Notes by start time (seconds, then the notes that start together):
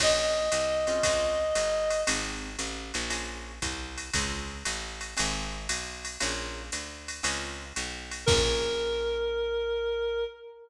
0.00 A#1 A#3 C#4 F4 G#4 D#5, kick, crash, ride
0.52 C2, hi-hat pedal, ride
0.87 C4 C#4 F4 G#4, ride
1.03 C#2, kick, ride
1.55 G1, hi-hat pedal, ride
1.90 ride
2.07 G#1 C4 D#4 G4 G#4, ride
2.59 A1, hi-hat pedal, ride
2.94 A#1, ride
3.10 A#3 C#4 F4 G#4, ride
3.62 C2, kick, hi-hat pedal, ride
3.98 ride
4.13 C#2 C4 C#4 F4 G#4, kick, ride
4.65 A1, hi-hat pedal, ride
5.01 ride
5.17 G#1 C4 D#4 G4 G#4, ride
5.69 B1, hi-hat pedal, ride
6.05 ride
6.20 A#1 A#3 C#4 F4 G#4, ride
6.72 D2, hi-hat pedal, ride
7.08 ride
7.23 C#2 C4 C#4 F4 G#4, ride
7.76 B1, hi-hat pedal, ride
8.11 ride
8.26 A#1 A#3 C#4 F4 G#4 A#4, kick, crash